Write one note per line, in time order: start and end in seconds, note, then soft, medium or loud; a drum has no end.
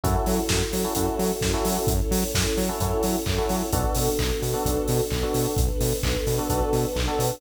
0.03 0.16 F#2 medium
0.03 1.86 C#4 medium
0.03 0.40 C#4 medium
0.03 1.86 E4 medium
0.03 0.40 E4 medium
0.03 1.86 F#4 medium
0.03 0.40 F#4 medium
0.03 1.86 A4 medium
0.03 0.40 A4 medium
0.03 kick medium
0.03 closed hi-hat medium
0.26 0.39 F#3 medium
0.26 open hi-hat medium
0.49 0.62 F#2 medium
0.49 kick medium
0.49 snare loud
0.73 0.86 F#3 medium
0.73 open hi-hat medium
0.84 0.94 C#4 medium
0.84 0.94 E4 medium
0.84 0.94 F#4 medium
0.84 0.94 A4 medium
0.95 1.09 F#2 medium
0.95 1.33 C#4 medium
0.95 1.33 E4 medium
0.95 1.33 F#4 medium
0.95 1.33 A4 medium
0.95 kick medium
0.95 closed hi-hat loud
1.19 1.32 F#3 medium
1.19 open hi-hat medium
1.41 1.55 F#2 medium
1.41 kick medium
1.41 snare medium
1.54 1.90 C#4 medium
1.54 1.90 E4 medium
1.54 1.90 F#4 medium
1.54 1.90 A4 medium
1.65 1.78 F#3 medium
1.65 open hi-hat medium
1.87 2.01 F#2 medium
1.87 3.71 C#4 medium
1.87 3.71 E4 medium
1.87 3.71 A4 medium
1.87 3.71 C#5 medium
1.87 kick loud
1.87 closed hi-hat medium
2.11 2.24 F#3 medium
2.11 open hi-hat medium
2.34 2.47 F#2 medium
2.34 kick medium
2.34 snare loud
2.57 2.70 F#3 medium
2.57 open hi-hat medium
2.69 2.78 C#4 medium
2.69 2.78 E4 medium
2.69 2.78 F#4 medium
2.69 2.78 A4 medium
2.80 2.93 F#2 medium
2.80 3.17 C#4 medium
2.80 3.17 E4 medium
2.80 3.17 F#4 medium
2.80 3.17 A4 medium
2.80 kick medium
2.80 closed hi-hat medium
3.03 3.16 F#3 medium
3.03 open hi-hat medium
3.26 3.39 F#2 medium
3.26 kick medium
3.26 clap medium
3.38 3.66 C#4 medium
3.38 3.66 E4 medium
3.38 3.66 F#4 medium
3.38 3.66 A4 medium
3.49 3.62 F#3 medium
3.49 open hi-hat medium
3.72 3.85 B1 medium
3.72 5.55 B3 medium
3.72 4.10 B3 medium
3.72 5.55 D4 medium
3.72 4.10 D4 medium
3.72 5.55 F#4 medium
3.72 4.10 F#4 medium
3.72 5.55 A4 medium
3.72 4.10 A4 medium
3.72 kick loud
3.72 closed hi-hat medium
3.95 4.09 B2 medium
3.95 open hi-hat medium
4.19 4.32 B1 medium
4.19 kick medium
4.19 clap medium
4.42 4.55 B2 medium
4.42 open hi-hat medium
4.54 4.63 B3 medium
4.54 4.63 D4 medium
4.54 4.63 F#4 medium
4.54 4.63 A4 medium
4.65 4.78 B1 medium
4.65 5.02 B3 medium
4.65 5.02 D4 medium
4.65 5.02 F#4 medium
4.65 5.02 A4 medium
4.65 kick medium
4.65 closed hi-hat medium
4.88 5.01 B2 medium
4.88 open hi-hat medium
5.10 5.24 B1 medium
5.10 kick medium
5.10 clap medium
5.23 5.60 B3 medium
5.23 5.60 D4 medium
5.23 5.60 F#4 medium
5.23 5.60 A4 medium
5.34 5.47 B2 medium
5.34 open hi-hat medium
5.57 5.70 B1 medium
5.57 7.40 B3 medium
5.57 7.40 D4 medium
5.57 7.40 A4 medium
5.57 7.40 B4 medium
5.57 kick loud
5.57 closed hi-hat medium
5.80 5.93 B2 medium
5.80 open hi-hat medium
6.03 6.16 B1 medium
6.03 kick medium
6.03 clap loud
6.27 6.39 B2 medium
6.27 open hi-hat medium
6.38 6.47 B3 medium
6.38 6.47 D4 medium
6.38 6.47 F#4 medium
6.38 6.47 A4 medium
6.49 6.62 B1 medium
6.49 6.87 B3 medium
6.49 6.87 D4 medium
6.49 6.87 F#4 medium
6.49 6.87 A4 medium
6.49 kick medium
6.49 closed hi-hat medium
6.73 6.85 B2 medium
6.73 open hi-hat medium
6.96 7.09 B1 medium
6.96 kick medium
6.96 clap medium
7.07 7.35 B3 medium
7.07 7.35 D4 medium
7.07 7.35 F#4 medium
7.07 7.35 A4 medium
7.19 7.32 B2 medium
7.19 open hi-hat medium